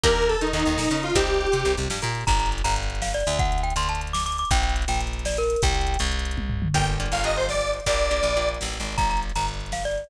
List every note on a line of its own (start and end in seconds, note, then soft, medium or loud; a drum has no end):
0.04 0.36 D#2 loud
0.04 0.37 A#3 loud
0.04 0.37 D4 loud
0.04 0.37 D#4 loud
0.04 0.37 G4 loud
0.04 0.27 A#4 loud
0.04 kick loud
0.04 closed hi-hat loud
0.10 closed hi-hat medium
0.16 closed hi-hat medium
0.22 closed hi-hat loud
0.28 0.40 A4 medium
0.28 closed hi-hat loud
0.35 closed hi-hat medium
0.41 0.52 D#3 medium
0.41 0.52 D#4 medium
0.41 closed hi-hat loud
0.47 closed hi-hat loud
0.53 0.64 D#2 medium
0.53 0.64 D#3 medium
0.53 1.02 D#4 medium
0.53 closed hi-hat loud
0.60 closed hi-hat loud
0.65 0.77 D#2 medium
0.65 0.76 D#3 medium
0.65 closed hi-hat loud
0.72 closed hi-hat medium
0.78 0.88 A#2 medium
0.78 0.89 A#3 medium
0.78 snare loud
0.85 closed hi-hat loud
0.90 1.12 C#3 medium
0.90 1.12 C#4 medium
0.90 closed hi-hat loud
0.97 closed hi-hat medium
1.03 1.15 F4 medium
1.03 closed hi-hat loud
1.10 closed hi-hat medium
1.15 1.47 C2 loud
1.15 1.49 C4 loud
1.15 1.49 D#4 loud
1.15 1.73 G4 medium
1.15 1.49 G4 loud
1.15 kick loud
1.15 closed hi-hat loud
1.21 closed hi-hat loud
1.27 closed hi-hat medium
1.34 closed hi-hat medium
1.41 closed hi-hat medium
1.47 closed hi-hat medium
1.52 1.64 C3 medium
1.52 1.63 C4 medium
1.52 closed hi-hat loud
1.60 closed hi-hat medium
1.65 1.76 C2 medium
1.65 1.76 C3 medium
1.65 closed hi-hat loud
1.71 closed hi-hat medium
1.77 1.89 C2 medium
1.77 1.88 C3 medium
1.77 closed hi-hat loud
1.83 closed hi-hat loud
1.90 2.01 G2 medium
1.90 2.01 G3 medium
1.90 snare loud
1.97 closed hi-hat loud
2.02 2.24 A#2 loud
2.02 2.24 A#3 medium
2.02 closed hi-hat loud
2.09 closed hi-hat medium
2.15 closed hi-hat loud
2.21 closed hi-hat medium
2.27 2.62 G1 loud
2.27 2.38 A#5 loud
2.27 kick loud
2.27 closed hi-hat loud
2.34 closed hi-hat loud
2.40 2.50 A#5 loud
2.40 closed hi-hat loud
2.46 closed hi-hat loud
2.52 closed hi-hat loud
2.58 closed hi-hat loud
2.64 3.23 G1 loud
2.64 2.74 A#5 loud
2.64 closed hi-hat loud
2.71 closed hi-hat loud
2.76 closed hi-hat loud
2.83 closed hi-hat loud
2.90 closed hi-hat loud
2.95 closed hi-hat loud
3.02 3.13 F5 loud
3.02 snare loud
3.08 closed hi-hat medium
3.14 3.38 D5 loud
3.14 closed hi-hat loud
3.20 closed hi-hat loud
3.27 3.74 D2 loud
3.27 closed hi-hat loud
3.33 closed hi-hat loud
3.39 3.61 F#5 loud
3.39 kick loud
3.39 closed hi-hat loud
3.45 closed hi-hat medium
3.52 closed hi-hat loud
3.58 closed hi-hat loud
3.63 3.74 G5 loud
3.63 closed hi-hat loud
3.70 closed hi-hat loud
3.76 4.44 D2 loud
3.76 3.88 C6 loud
3.76 closed hi-hat loud
3.83 closed hi-hat loud
3.89 4.01 A5 loud
3.89 closed hi-hat loud
3.95 closed hi-hat loud
4.01 closed hi-hat loud
4.07 closed hi-hat loud
4.13 4.24 D6 loud
4.13 snare loud
4.20 closed hi-hat loud
4.26 4.37 D6 loud
4.26 closed hi-hat loud
4.32 closed hi-hat loud
4.38 4.50 D6 loud
4.38 closed hi-hat loud
4.45 closed hi-hat loud
4.51 4.85 A#1 loud
4.51 4.62 G5 loud
4.51 kick loud
4.51 closed hi-hat loud
4.57 closed hi-hat loud
4.63 4.74 G5 loud
4.63 closed hi-hat loud
4.69 closed hi-hat loud
4.76 closed hi-hat loud
4.82 closed hi-hat loud
4.88 5.56 A#1 medium
4.88 5.00 G5 loud
4.88 closed hi-hat loud
4.94 closed hi-hat loud
5.01 closed hi-hat loud
5.07 closed hi-hat loud
5.13 closed hi-hat loud
5.19 closed hi-hat loud
5.25 5.37 D5 loud
5.25 snare loud
5.32 closed hi-hat loud
5.37 5.61 A#4 loud
5.37 closed hi-hat loud
5.43 closed hi-hat loud
5.50 closed hi-hat loud
5.56 closed hi-hat loud
5.62 5.97 C2 loud
5.62 5.99 G5 loud
5.62 kick loud
5.62 closed hi-hat loud
5.69 closed hi-hat medium
5.75 closed hi-hat loud
5.81 closed hi-hat loud
5.87 closed hi-hat loud
5.94 closed hi-hat loud
5.99 6.68 C2 loud
5.99 closed hi-hat loud
6.06 closed hi-hat loud
6.12 closed hi-hat loud
6.19 closed hi-hat loud
6.25 closed hi-hat loud
6.31 closed hi-hat loud
6.37 kick loud
6.37 high tom loud
6.50 floor tom loud
6.62 mid tom loud
6.74 7.09 G1 medium
6.74 6.97 A#3 medium
6.74 6.97 D4 medium
6.74 6.97 F4 medium
6.74 6.97 G4 medium
6.74 6.87 G5 medium
6.74 kick loud
6.74 closed hi-hat loud
6.81 closed hi-hat medium
6.87 closed hi-hat loud
6.93 closed hi-hat medium
7.00 7.23 A#3 medium
7.00 7.23 D4 medium
7.00 7.23 F4 medium
7.00 7.23 G4 medium
7.00 closed hi-hat loud
7.06 closed hi-hat medium
7.12 7.80 G1 medium
7.12 7.22 F5 medium
7.12 closed hi-hat loud
7.18 closed hi-hat medium
7.24 7.81 A#3 medium
7.24 7.81 D4 medium
7.24 7.81 F4 medium
7.24 7.81 G4 medium
7.24 7.35 D#5 medium
7.24 closed hi-hat medium
7.30 closed hi-hat medium
7.36 7.47 C5 medium
7.36 closed hi-hat medium
7.43 closed hi-hat medium
7.49 7.71 D5 medium
7.49 snare loud
7.55 closed hi-hat medium
7.61 closed hi-hat loud
7.67 closed hi-hat medium
7.73 closed hi-hat medium
7.80 closed hi-hat medium
7.86 8.21 A#1 loud
7.86 8.09 A#3 loud
7.86 8.09 D4 medium
7.86 8.09 F4 medium
7.86 8.09 G4 medium
7.86 8.48 D5 medium
7.86 kick loud
7.86 closed hi-hat loud
7.93 closed hi-hat medium
7.99 closed hi-hat medium
8.05 closed hi-hat medium
8.11 8.34 A#3 medium
8.11 8.34 D4 medium
8.11 8.34 F4 medium
8.11 8.34 G4 medium
8.11 closed hi-hat medium
8.17 closed hi-hat medium
8.23 8.58 A#1 medium
8.23 closed hi-hat loud
8.30 closed hi-hat medium
8.36 8.94 A#3 medium
8.36 8.94 D4 medium
8.36 8.94 F4 medium
8.36 8.94 G4 medium
8.36 closed hi-hat medium
8.42 closed hi-hat medium
8.49 closed hi-hat medium
8.54 closed hi-hat medium
8.61 8.79 A1 medium
8.61 snare loud
8.68 closed hi-hat medium
8.74 closed hi-hat medium
8.80 8.97 G#1 medium
8.80 closed hi-hat medium
8.85 closed hi-hat medium
8.92 closed hi-hat medium
8.98 9.32 G1 medium
8.98 9.09 A#5 loud
8.98 kick loud
8.98 closed hi-hat loud
9.05 closed hi-hat medium
9.10 9.20 A#5 loud
9.10 closed hi-hat medium
9.17 closed hi-hat loud
9.23 closed hi-hat medium
9.30 closed hi-hat medium
9.36 10.04 G1 medium
9.36 9.46 A#5 loud
9.36 closed hi-hat loud
9.42 closed hi-hat medium
9.48 closed hi-hat loud
9.54 closed hi-hat medium
9.60 closed hi-hat medium
9.66 closed hi-hat medium
9.72 9.84 F5 loud
9.72 snare loud
9.79 closed hi-hat medium
9.85 10.09 D5 loud
9.85 closed hi-hat medium
9.91 closed hi-hat medium
9.98 closed hi-hat medium
10.04 closed hi-hat medium